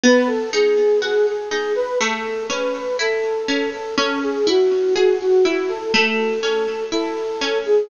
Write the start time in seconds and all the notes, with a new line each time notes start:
0.03 B3 B4
0.27 A4
0.53 D#4 G#4
1.02 F#4 G#4
1.27 G#4
1.50 D#4 G#4
1.75 B4
2.00 A3 A4
2.49 C#4 B4
2.99 E4 A4
3.48 C#4
3.73 A4
3.96 C#4 A4
4.23 G#4
4.47 E4 F#4
4.94 F#4 G#4
5.21 F#4
5.45 E4 F#4
5.69 A4
5.94 A3 A4
6.42 C#4 A4
6.92 E4 A4
7.41 C#4
7.65 G#4